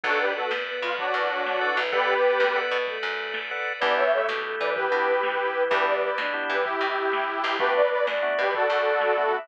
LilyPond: <<
  \new Staff \with { instrumentName = "Harmonica" } { \time 12/8 \key b \minor \tempo 4. = 127 <fis' a'>8 <g' b'>8 <fis' a'>8 r4 eis'8 <d' fis'>2. | <g' b'>2~ <g' b'>8 r2. r8 | <b' d''>8 <cis'' e''>8 <cis'' e''>8 r4 <b' d''>8 <g' b'>2. | <g' b'>8 <b' d''>8 <b' d''>8 r4 <g' b'>8 <e' g'>2. |
<g' b'>8 <b' d''>8 <b' d''>8 r4 <g' b'>8 <fis' a'>2. | }
  \new Staff \with { instrumentName = "Choir Aahs" } { \time 12/8 \key b \minor d'4 b4 b4 fis8 e8 fis8 fis8 e8 e8 | b2. a2 r4 | b4 a4 a4 e8 e8 e8 e8 e8 e8 | g4. d'4. g'2~ g'8 e'8 |
b'4. d''4. d''2~ d''8 e''8 | }
  \new Staff \with { instrumentName = "Drawbar Organ" } { \time 12/8 \key b \minor <a' b' d'' fis''>1~ <a' b' d'' fis''>4 <a' b' d'' fis''>4 | <a' b' d'' fis''>2 <a' b' d'' fis''>2. <a' b' d'' fis''>4 | <b d' e' g'>2.~ <b d' e' g'>8 <b d' e' g'>2~ <b d' e' g'>8 | <b d' e' g'>2 <b d' e' g'>1 |
<a b d' fis'>2 <a b d' fis'>2. <a b d' fis'>4 | }
  \new Staff \with { instrumentName = "Electric Bass (finger)" } { \clef bass \time 12/8 \key b \minor b,,4. fis,4 b,4 fis,2 b,,8~ | b,,4. fis,4 b,4 fis,2~ fis,8 | e,4. b,4 e4 b,2~ b,8 | e,4. b,4 e4 b,2 b,,8~ |
b,,4. fis,4 b,4 fis,2~ fis,8 | }
  \new Staff \with { instrumentName = "Drawbar Organ" } { \time 12/8 \key b \minor <a' b' d'' fis''>1. | <a' b' d'' fis''>1. | <b d' e' g'>1. | <b d' e' g'>1. |
<a b d' fis'>1. | }
  \new DrumStaff \with { instrumentName = "Drums" } \drummode { \time 12/8 <hh bd>4 hh8 sn4 hh8 <hh bd>4 hh8 sn4 hh8 | <hh bd>4 hh8 sn4 hh8 <hh bd>4 hh8 sn4 hh8 | <hh bd>4 hh8 sn4 hh8 <hh bd>4 hh8 sn4 hh8 | <hh bd>4 hh8 sn4 hh8 <hh bd>4 hh8 sn4 hh8 |
<hh bd>4 hh8 sn4 hh8 <hh bd>4 hh8 sn4 hh8 | }
>>